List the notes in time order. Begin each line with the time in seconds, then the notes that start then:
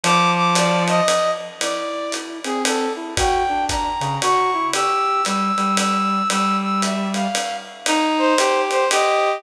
0.04 F3 D6, ride
0.36 D6
0.55 D5, hi-hat pedal, ride
0.88 D#5, ride
1.08 ride
1.60 E4 D5, ride
2.12 hi-hat pedal, ride
2.44 C4 G#4, ride
2.65 A4, ride
2.96 E4
3.17 F#4 G5, kick, ride
3.49 D4
3.69 A#5, kick, hi-hat pedal, ride
4.00 C#3, ride
4.22 F#4 C#6, ride
4.54 E4
4.73 G4 E6, ride
5.25 G3 E6, hi-hat pedal, ride
5.57 G3, ride
5.77 E6, ride
6.30 G3 E6, ride
6.62 E6
6.82 E5, hi-hat pedal, ride
7.14 F5, ride
7.35 ride
7.86 D#4, ride
8.18 C5
8.38 G4, hi-hat pedal, ride
8.71 C5, ride
8.91 G4 D#5, ride